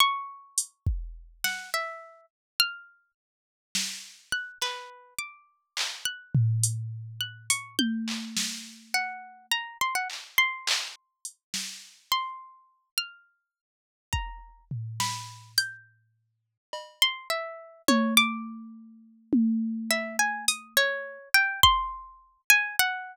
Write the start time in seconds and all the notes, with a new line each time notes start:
0.00 C#6
0.58 closed hi-hat
0.87 kick
1.44 F#5, snare
1.74 E5
2.60 F6
3.75 snare
4.32 F#6
4.62 B4, clap
5.19 D6
5.77 clap
6.05 F#6
6.35 floor tom
6.63 closed hi-hat
7.21 F#6
7.50 C#6, closed hi-hat
7.79 G6, high tom
8.08 clap
8.37 snare
8.94 F#5
9.51 A#5
9.81 C6
9.95 F#5
10.10 clap
10.38 C6
10.67 clap
11.25 closed hi-hat
11.54 snare
12.12 C6
12.98 F6
14.13 A#5, kick
14.71 floor tom
15.00 B5, snare
15.58 G6, closed hi-hat
16.73 cowbell
17.02 C6
17.30 E5
17.88 C#5, high tom
18.17 D6, closed hi-hat
19.33 high tom
19.90 E5, cowbell
20.19 G#5
20.48 D#6, closed hi-hat
20.77 C#5
21.34 G5
21.63 C6, kick
22.50 G#5
22.79 F#5